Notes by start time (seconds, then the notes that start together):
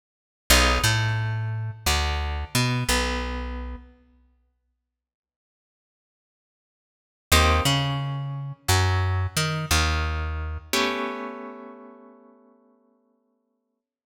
0.50 B1 B3 D#4 F4 G#4
0.84 A2 A3
1.86 D2 D3
2.55 B2 B3
2.89 B1 B3
7.32 D#2 A#3 C4 D#4 G4
7.65 C#3 C#4
8.68 F#2 F#3
9.37 D#3 D#4
9.71 D#2 D#3
10.73 A3 B3 C#4 G4